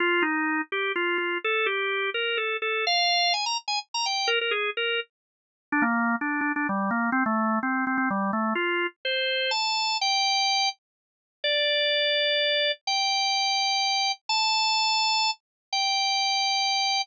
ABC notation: X:1
M:3/4
L:1/16
Q:1/4=126
K:Fm
V:1 name="Drawbar Organ"
F2 E4 G2 F2 F2 | =A2 G4 B2 A2 A2 | f4 a b z a z b g2 | B B A2 B2 z6 |
[K:Gm] D B,3 D2 D D G,2 B,2 | C A,3 C2 C C G,2 A,2 | F3 z c4 a4 | g6 z6 |
d12 | g12 | a10 z2 | g12 |]